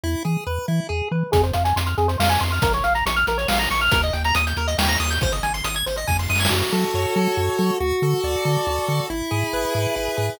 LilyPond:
<<
  \new Staff \with { instrumentName = "Lead 1 (square)" } { \time 3/4 \key fis \minor \tempo 4 = 139 e'8 gis'8 b'8 e'8 gis'8 b'8 | \key f \minor aes'16 c''16 f''16 aes''16 c'''16 f'''16 aes'16 c''16 f''16 aes''16 c'''16 f'''16 | bes'16 des''16 f''16 bes''16 des'''16 f'''16 bes'16 des''16 f''16 bes''16 des'''16 f'''16 | bes'16 ees''16 g''16 bes''16 ees'''16 g'''16 bes'16 ees''16 g''16 bes''16 ees'''16 g'''16 |
c''16 ees''16 aes''16 c'''16 ees'''16 aes'''16 c''16 ees''16 aes''16 c'''16 ees'''16 aes'''16 | \key fis \minor fis'8 a'8 cis''8 a'8 fis'8 a'8 | fis'8 a'8 d''8 a'8 fis'8 a'8 | e'8 gis'8 b'8 gis'8 e'8 gis'8 | }
  \new Staff \with { instrumentName = "Synth Bass 1" } { \clef bass \time 3/4 \key fis \minor e,8 e8 e,8 e8 e,8 e8 | \key f \minor f,8 f,8 f,8 f,8 f,8 f,8 | bes,,8 bes,,8 bes,,8 bes,,8 bes,,8 bes,,8 | ees,8 ees,8 ees,8 ees,8 ees,8 ees,8 |
aes,,8 aes,,8 aes,,8 aes,,8 f,8 ges,8 | \key fis \minor fis,8 fis8 fis,8 fis8 fis,8 fis8 | d,8 d8 d,8 d8 d,8 d8 | gis,,8 gis,8 gis,,8 gis,8 gis,,8 gis,8 | }
  \new DrumStaff \with { instrumentName = "Drums" } \drummode { \time 3/4 r4 r4 r4 | <hh bd>16 hh16 hh16 hh16 hh16 hh16 hh16 hh16 sn16 hh16 hh16 hh16 | <hh bd>16 hh16 hh16 hh16 hh16 hh16 hh16 hh16 sn16 hh16 hh16 hh16 | <hh bd>16 hh16 hh16 hh16 hh16 hh16 hh16 hh16 sn16 hh16 hh16 hho16 |
<hh bd>16 hh16 hh16 hh16 hh16 hh16 hh16 hh16 <bd sn>16 sn16 sn32 sn32 sn32 sn32 | r4 r4 r4 | r4 r4 r4 | r4 r4 r4 | }
>>